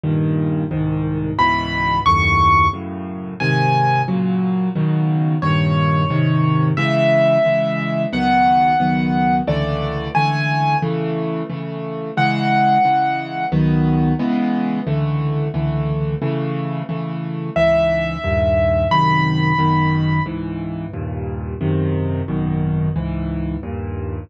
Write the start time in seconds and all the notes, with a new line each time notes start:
0.04 G2 A#2 D#3
0.71 C2 G#2 D#3
1.38 C#2 G#2 B2 E3 B5
2.06 D#2 F#2 A2 C#6
2.73 F#2 A2 C#3
3.40 G#2 C3 D#3 G#5
4.08 A#2 C#3 F#3
4.75 B2 C#3 D#3 F#3
5.42 G2 A#2 D#3 C#5
6.10 G#2 C3 D#3
6.77 C#3 E3 G#3 E5
7.45 C#3 E3 G#3
8.13 C#2 D#3 F#3 B3 F#5
8.80 C#2 D#3 F#3 B3
9.47 C#2 D3 E3 A3 D5
10.15 C#2 D3 E3 A3 G#5
10.82 C#3 E3 A3
11.50 C#3 E3 A3
12.17 C#3 E3 G#3 F#5
12.85 C#3 E3 G#3
13.52 C#2 D#3 F#3 B3
14.19 C#3 E3 G#3 B3
14.87 C#2 D3 E3 A3
15.54 C#2 D3 E3 A3
16.22 C#3 E3 A3
16.89 C#3 E3 A3
17.56 C#2 G#2 E3 E5
18.24 D#2 G2 A#2
18.91 G#1 F#2 C3 D#3 B5
19.59 G#1 F#2 B2 D#3
20.26 C#2 G#2 E3
20.94 D#2 G2 A#2
21.61 G#1 F#2 C3 D#3
22.28 G#1 F#2 B2 D#3
22.96 C#2 G#2 E3
23.63 D#2 G2 A#2